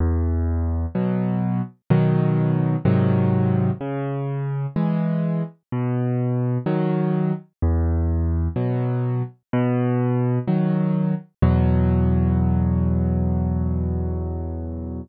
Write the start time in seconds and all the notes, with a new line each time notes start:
0.00 E2
0.95 B2 F#3
1.90 B2 D#3 F#3
2.85 G#2 C3 D#3 F#3
3.81 C#3
4.76 E3 G#3
5.72 B2
6.66 D#3 F#3
7.63 E2
8.56 B2 F#3
9.53 B2
10.48 D#3 F#3
11.42 E2 B2 F#3